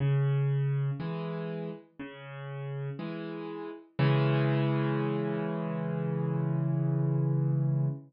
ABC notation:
X:1
M:4/4
L:1/8
Q:1/4=60
K:C#m
V:1 name="Acoustic Grand Piano" clef=bass
C,2 [E,G,]2 C,2 [E,G,]2 | [C,E,G,]8 |]